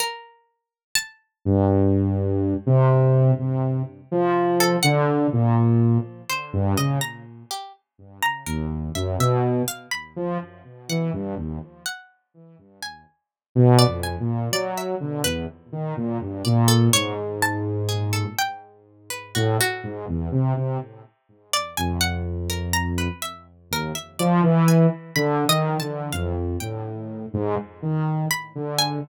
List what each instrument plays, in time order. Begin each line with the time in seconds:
0.00 harpsichord A#4
0.95 harpsichord A5
1.45 lead 2 (sawtooth) G2
2.66 lead 2 (sawtooth) C3
3.39 lead 2 (sawtooth) C3
4.11 lead 2 (sawtooth) F3
4.60 harpsichord A4
4.83 lead 2 (sawtooth) D3, harpsichord F#5
5.33 lead 2 (sawtooth) A#2
6.29 harpsichord C5
6.53 lead 2 (sawtooth) G2
6.77 lead 2 (sawtooth) C#3, harpsichord D#5
7.01 harpsichord A#5
7.51 harpsichord G4
8.23 harpsichord A#5
8.46 lead 2 (sawtooth) D#2, harpsichord A#4
8.95 lead 2 (sawtooth) F#2, harpsichord E5
9.19 lead 2 (sawtooth) B2, harpsichord E5
9.68 harpsichord F5
9.91 harpsichord B5
10.16 lead 2 (sawtooth) F3
10.89 lead 2 (sawtooth) E3, harpsichord F#5
11.13 lead 2 (sawtooth) G2
11.37 lead 2 (sawtooth) D#2
11.86 harpsichord F#5
12.82 harpsichord G#5
13.55 lead 2 (sawtooth) B2
13.79 harpsichord D5
13.87 lead 2 (sawtooth) F2
14.03 harpsichord G#5
14.20 lead 2 (sawtooth) A#2
14.52 lead 2 (sawtooth) F#3, harpsichord D5
14.77 harpsichord E5
15.00 lead 2 (sawtooth) D3
15.24 lead 2 (sawtooth) E2, harpsichord B4
15.72 lead 2 (sawtooth) D#3
15.97 lead 2 (sawtooth) A#2
16.21 lead 2 (sawtooth) G2
16.45 lead 2 (sawtooth) A#2, harpsichord D5
16.68 harpsichord A4
16.93 lead 2 (sawtooth) G#2, harpsichord C#5
17.42 harpsichord A5
17.89 harpsichord G#4
18.13 harpsichord A4
18.39 harpsichord G5
19.10 harpsichord B4
19.35 lead 2 (sawtooth) A2, harpsichord F#4
19.60 harpsichord F#4
19.83 lead 2 (sawtooth) G#2
20.08 lead 2 (sawtooth) E2
20.32 lead 2 (sawtooth) C3
20.56 lead 2 (sawtooth) C3
21.53 harpsichord D5
21.77 lead 2 (sawtooth) F2, harpsichord G#5
22.01 harpsichord F#5
22.50 harpsichord A#4
22.73 harpsichord A#5
22.98 harpsichord B4
23.22 harpsichord E5
23.71 lead 2 (sawtooth) D#2, harpsichord A#4
23.95 harpsichord E5
24.19 lead 2 (sawtooth) F3, harpsichord D5
24.43 lead 2 (sawtooth) E3
24.68 harpsichord G#5
25.16 lead 2 (sawtooth) D3, harpsichord B5
25.48 lead 2 (sawtooth) D#3, harpsichord D#5
25.80 lead 2 (sawtooth) D3, harpsichord A5
26.13 lead 2 (sawtooth) F2, harpsichord F5
26.60 lead 2 (sawtooth) A2, harpsichord G5
27.33 lead 2 (sawtooth) G#2
27.82 lead 2 (sawtooth) D#3
28.31 harpsichord B5
28.55 lead 2 (sawtooth) D3
28.78 harpsichord G#5